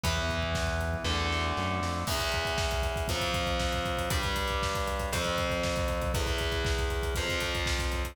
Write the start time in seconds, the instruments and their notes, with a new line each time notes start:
0.03 synth bass 1 E2, overdriven guitar E3 B3, kick, closed hi-hat
0.17 kick
0.29 kick, closed hi-hat
0.42 kick
0.55 kick, snare
0.67 kick
0.81 kick, closed hi-hat
0.94 kick
1.04 synth bass 1 E2, overdriven guitar D3 A3, kick, snare
1.32 snare
1.57 synth bass 1 F#2, snare
1.81 synth bass 1 F2, snare
2.07 overdriven guitar E2 E3 B3, kick, crash
2.19 kick, closed hi-hat
2.32 kick, closed hi-hat
2.45 kick, closed hi-hat
2.58 kick, snare
2.71 kick, closed hi-hat
2.82 kick, closed hi-hat
2.96 kick, closed hi-hat
3.08 overdriven guitar F2 F3 C4, kick, closed hi-hat
3.21 kick, closed hi-hat
3.34 kick, closed hi-hat
3.46 kick, closed hi-hat
3.60 kick, snare
3.72 kick, closed hi-hat
3.85 kick, closed hi-hat
3.97 kick, closed hi-hat
4.10 overdriven guitar G2 G3 D4, kick, closed hi-hat
4.23 kick, closed hi-hat
4.36 kick, closed hi-hat
4.48 kick, closed hi-hat
4.63 kick, snare
4.75 kick, closed hi-hat
4.87 kick, closed hi-hat
4.99 kick, closed hi-hat
5.13 overdriven guitar F2 F3 C4, kick, closed hi-hat
5.24 kick, closed hi-hat
5.38 kick, closed hi-hat
5.50 kick, closed hi-hat
5.63 kick, snare
5.76 kick, closed hi-hat
5.88 kick, closed hi-hat
6.01 kick, closed hi-hat
6.14 overdriven guitar E2 E3 B3, kick, closed hi-hat
6.26 kick, closed hi-hat
6.38 kick, closed hi-hat
6.52 kick, closed hi-hat
6.65 kick, snare
6.78 kick, closed hi-hat
6.90 kick, closed hi-hat
7.03 kick, closed hi-hat
7.15 overdriven guitar F2 F3 C4, kick, closed hi-hat
7.29 kick, closed hi-hat
7.40 kick, closed hi-hat
7.55 kick, closed hi-hat
7.66 kick, snare
7.79 kick, closed hi-hat
7.92 kick, closed hi-hat
8.04 kick, closed hi-hat